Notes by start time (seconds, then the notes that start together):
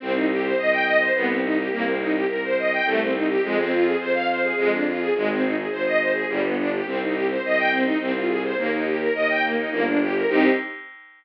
0.00 C2 C4
0.13 D#4
0.30 G4
0.43 C5
0.57 C2 D#5
0.72 G5
0.84 D#5
0.99 C5
1.15 C2 B3
1.28 C4
1.43 D#4
1.57 G4
1.71 C2 A#3
1.85 C4
2.00 D#4
2.13 G4
2.28 C2 A#4
2.43 C5
2.58 D#5
2.72 G5
2.84 C2 A3
3.00 C4
3.13 D#4
3.28 G4
3.43 F2 G#3
3.59 C4
3.72 F4
3.85 G#4
3.99 F2 C5
4.14 F5
4.29 C5
4.42 G#4
4.57 F2 G#3
4.71 D4
4.87 F4
4.99 G#4
5.15 G#1 G#3
5.30 C4
5.43 D#4
5.56 G#4
5.71 G#1 C5
5.85 D#5
6.00 C5
6.13 G#4
6.28 G1 G3
6.43 B3
6.58 D4
6.73 G4
6.86 C2 C4
7.01 D#4
7.13 G4
7.30 C5
7.43 C2 D#5
7.58 G5
7.71 C4
7.85 D#4
8.00 C2 C4
8.15 F4
8.28 G#4
8.43 C5
8.57 D#2 A#3
8.73 D#4
8.86 G4
8.99 A#4
9.14 D#2 D#5
9.30 G5
9.43 A#3
9.57 D#4
9.71 G1 A#3
9.86 D4
10.01 G4
10.14 A#4
10.28 C2 C4 D#4 G4